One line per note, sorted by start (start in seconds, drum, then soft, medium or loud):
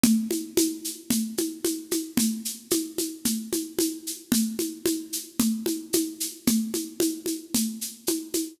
0.03 low conga loud
0.03 shaker medium
0.31 high conga medium
0.31 shaker medium
0.57 high conga loud
0.57 shaker medium
0.84 shaker medium
1.10 low conga medium
1.10 shaker medium
1.37 high conga medium
1.37 shaker medium
1.65 high conga medium
1.65 shaker medium
1.91 high conga medium
1.91 shaker medium
2.17 low conga loud
2.17 shaker medium
2.45 shaker medium
2.71 high conga medium
2.71 shaker medium
2.98 high conga medium
2.98 shaker medium
3.25 low conga medium
3.25 shaker medium
3.53 high conga medium
3.53 shaker medium
3.79 high conga medium
3.79 shaker medium
4.07 shaker medium
4.32 low conga loud
4.32 shaker medium
4.59 high conga medium
4.59 shaker medium
4.86 high conga medium
4.86 shaker medium
5.13 shaker medium
5.40 low conga loud
5.40 shaker medium
5.66 high conga medium
5.66 shaker medium
5.93 high conga medium
5.93 shaker medium
6.20 shaker medium
6.47 low conga loud
6.47 shaker medium
6.74 high conga medium
6.74 shaker medium
7.00 high conga medium
7.00 shaker medium
7.26 high conga medium
7.26 shaker medium
7.54 low conga medium
7.54 shaker medium
7.81 shaker medium
8.07 high conga medium
8.07 shaker medium
8.34 high conga medium
8.34 shaker medium